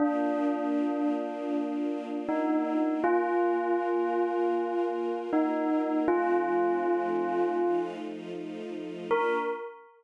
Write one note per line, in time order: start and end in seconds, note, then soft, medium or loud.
0.00 3.01 A#3 medium
0.00 2.19 D4 medium
0.00 3.01 D4 medium
0.00 3.01 F4 medium
2.29 2.91 D#4 medium
3.03 6.04 A#3 medium
3.03 6.04 F4 medium
3.03 5.17 F4 loud
3.03 6.04 A#4 medium
5.33 5.98 D#4 medium
6.08 7.58 F3 medium
6.08 7.58 A3 medium
6.08 7.58 C4 medium
6.08 7.58 D#4 medium
6.08 7.80 F4 loud
7.59 9.10 F3 medium
7.59 9.10 A3 medium
7.59 9.10 D#4 medium
7.59 9.10 F4 medium
9.11 9.38 A#3 loud
9.11 9.38 D4 loud
9.11 9.38 F4 medium
9.11 9.37 A#4 loud